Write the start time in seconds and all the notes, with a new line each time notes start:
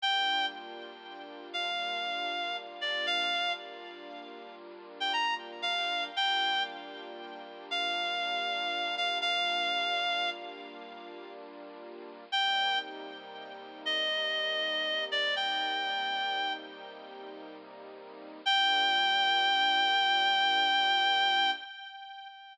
0.00 G3 A#3 D4 F4 G5
1.53 F5
2.81 D5
3.06 F5
5.00 G5
5.13 A#5
5.62 F5
6.15 G3 A#3 D4 F4 G5
7.71 F5
8.97 F5
9.21 F5
12.31 C3 G3 A#3 D#4 G5
13.85 D#5
15.11 D5
15.36 G5
18.46 G3 A#3 D4 F4 G5